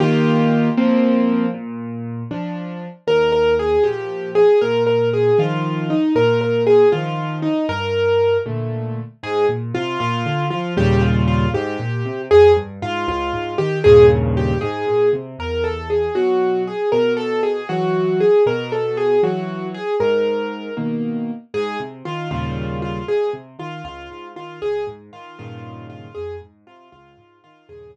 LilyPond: <<
  \new Staff \with { instrumentName = "Acoustic Grand Piano" } { \time 6/8 \key ees \major \tempo 4. = 78 r2. | r2. | bes'8 bes'8 aes'8 g'4 aes'8 | bes'8 bes'8 aes'8 f'4 ees'8 |
bes'8 bes'8 aes'8 f'4 ees'8 | bes'4. r4. | \key aes \major aes'8 r8 f'8 f'4 f'8 | g'8 f'8 f'8 g'4. |
aes'8 r8 f'8 f'4 g'8 | aes'8 r8 g'8 aes'4 r8 | \key e \major bes'8 a'8 gis'8 fis'4 gis'8 | bes'8 a'8 gis'8 fis'4 gis'8 |
bes'8 a'8 gis'8 fis'4 gis'8 | ais'4. r4. | \key aes \major aes'8 r8 f'8 f'4 f'8 | aes'8 r8 f'8 f'4 f'8 |
aes'8 r8 f'8 f'4 f'8 | aes'8 r8 f'8 f'4 f'8 | aes'8 r2 r8 | }
  \new Staff \with { instrumentName = "Acoustic Grand Piano" } { \time 6/8 \key ees \major <ees bes f' g'>4. <f bes c'>4. | bes,4. <f d'>4. | ees,4. <bes, f>4. | bes,4. <ees f>4. |
bes,4. <ees f>4. | g,4. <bes, d a>4. | \key aes \major aes,8 bes,8 c8 bes,8 d8 f8 | <ees, bes, des g>4. aes,8 bes,8 c8 |
f,8 g,8 aes,8 des,8 aes,8 ees8 | <ees, g, bes, des>4. aes,8 bes,8 c8 | \key e \major e,4. <b, fis>4. | b,4. <e fis>4. |
b,4. <e fis>4. | gis,4. <b, dis ais>4. | \key aes \major aes,8 c8 ees8 <ees, bes, des g>4. | aes,8 c8 ees8 des,8 aes,8 ees8 |
des,8 aes,8 ees8 <g, bes, des ees>4. | f,8 aes,8 c8 des,8 aes,8 ees8 | <ees, g, bes, des>4. r4. | }
>>